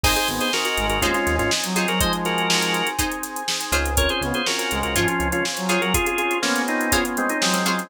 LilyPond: <<
  \new Staff \with { instrumentName = "Drawbar Organ" } { \time 4/4 \key aes \mixolydian \tempo 4 = 122 <aes' c''>16 <aes' c''>16 r16 <aes' c''>16 <ges' bes'>16 <ges' bes'>8 <ges' bes'>16 <des' f'>16 <des' f'>8 <des' f'>16 r8 <f' aes'>16 <ges' bes'>16 | <c'' ees''>16 r16 <ges' bes'>4. r2 | <bes' des''>16 <aes' c''>16 r16 <aes' c''>16 <ges' bes'>16 <ges' bes'>8 <ges' bes'>16 <des' f'>16 <des' f'>8 <des' f'>16 r8 <f' aes'>16 <ges' bes'>16 | <f' aes'>16 <f' aes'>16 <f' aes'>8 <bes des'>8 <c' ees'>8 <des' f'>16 r16 <aes c'>16 <c' ees'>16 <aes c'>16 <aes c'>16 <aes c'>8 | }
  \new Staff \with { instrumentName = "Brass Section" } { \time 4/4 \key aes \mixolydian r8 b8 r8 aes8 aes4 r16 ges8 ges16 | <f aes>2 r2 | r8 b8 r8 aes8 f4 r16 ges8 ges16 | r4 b2 ges4 | }
  \new Staff \with { instrumentName = "Pizzicato Strings" } { \time 4/4 \key aes \mixolydian <ees' aes' c''>2 <ees' aes' c''>4. <ees' aes' c''>8~ | <ees' aes' c''>2 <ees' aes' c''>4. <f' aes' c'' des''>8~ | <f' aes' c'' des''>2 <f' aes' c'' des''>4. <f' aes' c'' des''>8~ | <f' aes' c'' des''>2 <f' aes' c'' des''>4. <f' aes' c'' des''>8 | }
  \new Staff \with { instrumentName = "Drawbar Organ" } { \time 4/4 \key aes \mixolydian <c' ees' aes'>4 <c' ees' aes'>4 <c' ees' aes'>4 <c' ees' aes'>4 | <c' ees' aes'>4 <c' ees' aes'>4 <c' ees' aes'>4 <c' ees' aes'>4 | <c' des' f' aes'>4 <c' des' f' aes'>4 <c' des' f' aes'>4 <c' des' f' aes'>4 | <c' des' f' aes'>4 <c' des' f' aes'>4 <c' des' f' aes'>4 <c' des' f' aes'>4 | }
  \new Staff \with { instrumentName = "Synth Bass 1" } { \clef bass \time 4/4 \key aes \mixolydian aes,,8 aes,,4 aes,,16 aes,,16 ees,8 ees,16 aes,,4~ aes,,16~ | aes,,2.~ aes,,8 des,8~ | des,8 des,4 des,16 des,16 aes,8 des,16 des,4~ des,16~ | des,1 | }
  \new Staff \with { instrumentName = "Pad 5 (bowed)" } { \time 4/4 \key aes \mixolydian <c'' ees'' aes''>1 | <aes' c'' aes''>1 | <c'' des'' f'' aes''>1 | <c'' des'' aes'' c'''>1 | }
  \new DrumStaff \with { instrumentName = "Drums" } \drummode { \time 4/4 <cymc bd>16 <hh sn>16 hh16 hh16 sn16 hh16 hh16 hh16 <hh bd>16 <hh sn>16 <hh sn>16 <hh sn>16 sn16 <hh sn>16 hh16 <hh sn>16 | <hh bd>16 hh16 <hh sn>16 hh16 sn16 hh16 hh16 hh16 <hh bd>16 hh16 <hh sn>16 hh16 sn16 hh16 <hh sn>16 hh16 | <hh bd>16 hh16 <hh sn>16 hh16 sn16 hh16 hh16 hh16 <hh bd>16 hh16 hh16 hh16 sn16 hh16 hh16 hh16 | <hh bd>16 hh16 hh16 hh16 sn16 hh16 hh16 hh16 <hh bd>16 hh16 hh16 hh16 sn16 hh16 hh16 <hh sn>16 | }
>>